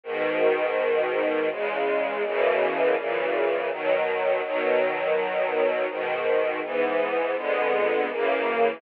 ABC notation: X:1
M:3/4
L:1/8
Q:1/4=82
K:B
V:1 name="String Ensemble 1"
[G,,B,,D,]4 [E,,C,G,]2 | [F,,B,,C,E,]2 [F,,A,,C,E,]2 [B,,D,F,]2 | [B,,D,F,]4 [G,,B,,D,]2 | [G,,E,B,]2 [^E,,=D,G,B,]2 [F,,C,=E,A,]2 |]